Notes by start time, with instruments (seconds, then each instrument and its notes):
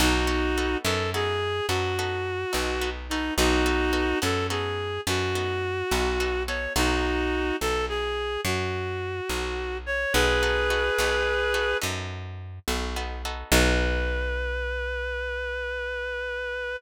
0.00 electric bass (finger) B1, acoustic guitar (steel) B3 D#4 F#4 A4, clarinet D#4 F#4
0.27 acoustic guitar (steel) B3 D#4 F#4 A4
0.58 acoustic guitar (steel) B3 D#4 F#4 A4
0.84 electric bass (finger) F#2, acoustic guitar (steel) B3 D#4 F#4 A4, clarinet A4
1.14 acoustic guitar (steel) B3 D#4 F#4 A4, clarinet G#4
1.68 electric bass (finger) F#2, acoustic guitar (steel) B3 D#4 F#4 A4, clarinet F#4
1.99 acoustic guitar (steel) B3 D#4 F#4 A4
2.53 electric bass (finger) B1, acoustic guitar (steel) B3 D#4 F#4 A4
2.81 acoustic guitar (steel) B3 D#4 F#4 A4
3.10 acoustic guitar (steel) B3 D#4 F#4 A4, clarinet D#4
3.37 electric bass (finger) B1, acoustic guitar (steel) B3 D#4 F#4 A4, clarinet D#4 F#4
3.66 acoustic guitar (steel) B3 D#4 F#4 A4
3.93 acoustic guitar (steel) B3 D#4 F#4 A4
4.22 electric bass (finger) F#2, acoustic guitar (steel) B3 D#4 F#4 A4, clarinet A4
4.50 acoustic guitar (steel) B3 D#4 F#4 A4, clarinet G#4
5.07 electric bass (finger) F#2, acoustic guitar (steel) B3 D#4 F#4 A4, clarinet F#4
5.35 acoustic guitar (steel) B3 D#4 F#4 A4
5.91 electric bass (finger) B1, acoustic guitar (steel) B3 D#4 F#4 A4
6.20 acoustic guitar (steel) B3 D#4 F#4 A4
6.47 acoustic guitar (steel) B3 D#4 F#4 A4, clarinet C#5
6.76 electric bass (finger) B1, acoustic guitar (steel) B3 D#4 F#4 A4, clarinet D#4 F#4
7.61 electric bass (finger) B1, clarinet A4
7.89 clarinet G#4
8.45 electric bass (finger) F#2, clarinet F#4
9.29 electric bass (finger) B1
9.86 clarinet C#5
10.13 electric bass (finger) B1, acoustic guitar (steel) B3 D#4 F#4 A4, clarinet G#4 B4
10.43 acoustic guitar (steel) B3 D#4 F#4 A4
10.70 acoustic guitar (steel) B3 D#4 F#4 A4
10.98 electric bass (finger) B1, acoustic guitar (steel) B3 D#4 F#4 A4
11.54 acoustic guitar (steel) B3 D#4 F#4 A4
11.81 electric bass (finger) F#2, acoustic guitar (steel) B3 D#4 F#4 A4
12.68 electric bass (finger) B1, acoustic guitar (steel) B3 D#4 F#4 A4
12.96 acoustic guitar (steel) B3 D#4 F#4 A4
13.25 acoustic guitar (steel) B3 D#4 F#4 A4
13.52 electric bass (finger) B1, acoustic guitar (steel) B3 D#4 F#4 A4, clarinet B4